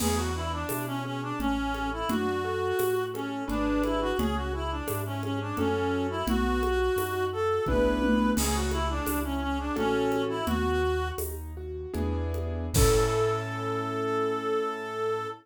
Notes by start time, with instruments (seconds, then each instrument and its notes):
0.00 acoustic grand piano E2 B3, clarinet G#4, crash, low conga
0.17 clarinet F#4
0.35 acoustic grand piano D4, clarinet E4
0.52 clarinet D4
0.69 acoustic grand piano B2 E4, tambourine, high conga
0.87 clarinet C#4
1.05 clarinet C#4, acoustic grand piano G#4
1.22 clarinet D4
1.39 acoustic grand piano A1 C#4, clarinet C#4, low conga
1.73 acoustic grand piano A4, high conga
1.92 clarinet E4
2.09 acoustic grand piano F#2 D4, clarinet F#4, low conga
2.45 acoustic grand piano A4
2.79 acoustic grand piano A2 F#4, tambourine, high conga
3.14 clarinet C#4, acoustic grand piano A4, high conga
3.48 acoustic grand piano G#1 D4 G#4 B4, clarinet D4, low conga
3.84 clarinet E4, high conga
4.01 clarinet F#4
4.19 acoustic grand piano C#2 C#4, clarinet G#4, low conga
4.36 clarinet F#4
4.53 clarinet E4, acoustic grand piano G#4
4.71 clarinet D4
4.88 acoustic grand piano G#2 E4, tambourine, high conga
5.06 clarinet C#4
5.23 clarinet C#4, acoustic grand piano G#4, high conga
5.41 clarinet D4
5.57 acoustic grand piano F#2 C#4 F#4 A4, clarinet C#4, low conga
6.10 clarinet E4
6.27 acoustic grand piano B1 B3, clarinet F#4, low conga
6.62 acoustic grand piano F#4, high conga
6.96 acoustic grand piano F#2 D#4, tambourine, high conga
7.33 acoustic grand piano F#4, clarinet A4
7.66 acoustic grand piano B1 B3 D4 E4 G#4, clarinet B4, kick, high tom
8.02 high tom
8.36 acoustic grand piano C#2 C#4, clarinet G#4, crash, low conga
8.55 clarinet F#4
8.71 clarinet E4, acoustic grand piano G#4, high conga
8.90 clarinet D4
9.06 acoustic grand piano C#2 E4, tambourine, high conga
9.24 clarinet C#4
9.42 clarinet C#4, acoustic grand piano G#4
9.59 clarinet D4
9.76 acoustic grand piano A1 C#4 F#4 A4, clarinet C#4, low conga
10.12 high conga
10.29 clarinet E4
10.46 acoustic grand piano D#2 B3, clarinet F#4, low conga
10.82 acoustic grand piano F#4
11.18 acoustic grand piano D#2 D#4, tambourine, high conga
11.57 acoustic grand piano F#4
11.94 acoustic grand piano E2 B3 D4 E4 G#4, low conga
12.34 high conga
12.74 acoustic grand piano A2 C#4 E4 A4, clarinet A4, kick, crash